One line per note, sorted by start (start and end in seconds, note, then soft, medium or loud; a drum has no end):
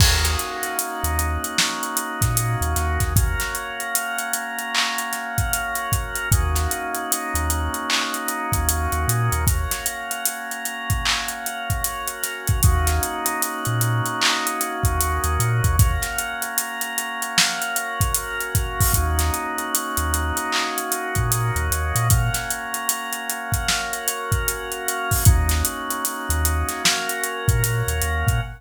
0.00 0.36 D#2 medium
0.00 3.13 A#3 medium
0.00 3.13 C#4 medium
0.00 3.13 D#4 medium
0.00 3.13 F#4 medium
0.00 kick medium
0.00 crash loud
0.24 snare medium
0.24 closed hi-hat medium
0.39 closed hi-hat medium
0.63 closed hi-hat medium
0.79 closed hi-hat medium
1.03 1.38 D#2 medium
1.03 closed hi-hat medium
1.19 closed hi-hat medium
1.44 closed hi-hat medium
1.58 snare medium
1.83 closed hi-hat medium
1.97 closed hi-hat medium
2.21 2.56 A#2 medium
2.21 kick medium
2.21 snare soft
2.21 closed hi-hat medium
2.37 closed hi-hat medium
2.61 2.75 D#2 medium
2.61 closed hi-hat medium
2.76 2.98 D#2 medium
2.76 snare soft
2.76 closed hi-hat medium
3.00 3.35 D#2 medium
3.00 kick medium
3.00 snare soft
3.00 closed hi-hat medium
3.16 6.29 A#3 medium
3.16 6.29 C#4 medium
3.16 6.29 F#4 medium
3.16 6.29 A#4 medium
3.16 kick medium
3.16 closed hi-hat medium
3.40 snare soft
3.40 closed hi-hat medium
3.55 closed hi-hat medium
3.80 closed hi-hat medium
3.95 closed hi-hat medium
4.19 closed hi-hat medium
4.33 closed hi-hat medium
4.59 closed hi-hat medium
4.75 clap loud
4.98 closed hi-hat medium
5.13 snare soft
5.13 closed hi-hat medium
5.38 kick medium
5.38 closed hi-hat medium
5.53 closed hi-hat medium
5.75 closed hi-hat medium
5.92 kick medium
5.92 closed hi-hat medium
6.15 closed hi-hat medium
6.31 6.68 D#2 medium
6.31 9.45 A#3 medium
6.31 9.45 C#4 medium
6.31 9.45 D#4 medium
6.31 9.45 F#4 medium
6.31 kick medium
6.31 closed hi-hat medium
6.55 snare soft
6.55 closed hi-hat medium
6.71 closed hi-hat medium
6.95 closed hi-hat medium
7.12 closed hi-hat medium
7.34 7.69 D#2 medium
7.34 closed hi-hat medium
7.50 closed hi-hat medium
7.74 closed hi-hat medium
7.90 clap loud
8.14 closed hi-hat medium
8.28 closed hi-hat medium
8.52 8.88 D#2 medium
8.52 kick medium
8.52 closed hi-hat medium
8.69 closed hi-hat medium
8.92 9.06 D#2 medium
8.92 closed hi-hat medium
9.08 9.30 A#2 medium
9.08 closed hi-hat medium
9.32 9.67 D#2 medium
9.32 closed hi-hat medium
9.47 12.61 A#3 medium
9.47 12.61 C#4 medium
9.47 12.61 F#4 medium
9.47 12.61 A#4 medium
9.47 kick medium
9.47 closed hi-hat medium
9.71 snare soft
9.71 closed hi-hat medium
9.86 closed hi-hat medium
10.11 closed hi-hat medium
10.25 closed hi-hat loud
10.51 closed hi-hat medium
10.65 closed hi-hat medium
10.90 kick medium
10.90 closed hi-hat medium
11.05 clap loud
11.28 closed hi-hat medium
11.46 closed hi-hat medium
11.70 kick medium
11.70 closed hi-hat medium
11.84 closed hi-hat medium
12.08 closed hi-hat medium
12.23 snare soft
12.23 closed hi-hat medium
12.47 kick medium
12.47 closed hi-hat medium
12.63 13.00 D#2 medium
12.63 15.76 A#3 medium
12.63 15.76 C#4 medium
12.63 15.76 D#4 medium
12.63 15.76 F#4 medium
12.63 kick loud
12.63 closed hi-hat medium
12.87 snare soft
12.87 closed hi-hat medium
13.03 closed hi-hat medium
13.26 closed hi-hat medium
13.42 closed hi-hat medium
13.65 14.01 A#2 medium
13.65 closed hi-hat medium
13.81 closed hi-hat medium
14.06 closed hi-hat medium
14.22 clap loud
14.47 closed hi-hat medium
14.61 closed hi-hat medium
14.83 15.19 D#2 medium
14.83 kick medium
14.83 closed hi-hat medium
15.01 closed hi-hat medium
15.24 15.38 D#2 medium
15.24 closed hi-hat medium
15.39 15.61 A#2 medium
15.39 closed hi-hat medium
15.64 15.98 D#2 medium
15.64 kick medium
15.64 closed hi-hat medium
15.79 18.92 A#3 medium
15.79 18.92 C#4 medium
15.79 18.92 F#4 medium
15.79 18.92 A#4 medium
15.79 kick loud
15.79 closed hi-hat medium
16.02 snare soft
16.02 closed hi-hat medium
16.18 closed hi-hat medium
16.42 closed hi-hat medium
16.58 closed hi-hat medium
16.81 closed hi-hat medium
16.98 closed hi-hat medium
17.22 closed hi-hat medium
17.38 snare loud
17.62 closed hi-hat medium
17.76 closed hi-hat medium
18.00 kick medium
18.00 closed hi-hat medium
18.14 closed hi-hat loud
18.40 closed hi-hat medium
18.55 kick medium
18.55 closed hi-hat medium
18.80 kick medium
18.80 open hi-hat medium
18.94 19.31 D#2 medium
18.94 22.08 A#3 medium
18.94 22.08 C#4 medium
18.94 22.08 D#4 medium
18.94 22.08 F#4 medium
18.94 kick medium
18.94 closed hi-hat medium
19.19 snare medium
19.19 closed hi-hat medium
19.34 closed hi-hat medium
19.58 closed hi-hat medium
19.75 closed hi-hat loud
19.97 20.32 D#2 medium
19.97 closed hi-hat medium
20.14 closed hi-hat medium
20.37 closed hi-hat medium
20.52 clap medium
20.78 closed hi-hat medium
20.92 closed hi-hat medium
21.15 21.51 A#2 medium
21.15 kick medium
21.15 closed hi-hat medium
21.32 closed hi-hat medium
21.56 21.69 D#2 medium
21.56 closed hi-hat medium
21.71 21.93 D#2 medium
21.71 closed hi-hat medium
21.95 22.30 A#2 medium
21.95 closed hi-hat medium
22.10 25.24 A#3 medium
22.10 25.24 C#4 medium
22.10 25.24 F#4 medium
22.10 25.24 A#4 medium
22.10 kick medium
22.10 closed hi-hat medium
22.34 snare soft
22.34 closed hi-hat medium
22.50 closed hi-hat medium
22.74 closed hi-hat medium
22.89 closed hi-hat loud
23.13 closed hi-hat medium
23.30 closed hi-hat medium
23.52 kick medium
23.52 closed hi-hat medium
23.68 snare medium
23.93 closed hi-hat medium
24.08 closed hi-hat medium
24.32 kick medium
24.32 closed hi-hat medium
24.48 closed hi-hat medium
24.72 closed hi-hat medium
24.88 closed hi-hat medium
25.11 kick medium
25.11 open hi-hat medium
25.25 25.63 D#2 medium
25.25 26.83 A#3 medium
25.25 26.83 C#4 medium
25.25 26.83 D#4 medium
25.25 26.83 F#4 medium
25.25 kick loud
25.25 closed hi-hat medium
25.49 snare medium
25.49 closed hi-hat medium
25.65 closed hi-hat medium
25.90 closed hi-hat medium
26.05 closed hi-hat loud
26.29 26.64 D#2 medium
26.29 closed hi-hat medium
26.45 closed hi-hat medium
26.69 snare soft
26.69 closed hi-hat medium
26.84 28.41 A#3 medium
26.84 28.41 C#4 medium
26.84 28.41 F#4 medium
26.84 28.41 A#4 medium
26.84 snare loud
27.09 closed hi-hat medium
27.24 closed hi-hat medium
27.48 27.83 A#2 medium
27.48 kick medium
27.48 closed hi-hat medium
27.64 closed hi-hat loud
27.87 28.01 D#2 medium
27.87 closed hi-hat medium
28.02 28.24 D#2 medium
28.02 closed hi-hat medium
28.27 28.40 A#2 medium
28.27 kick medium
28.27 closed hi-hat medium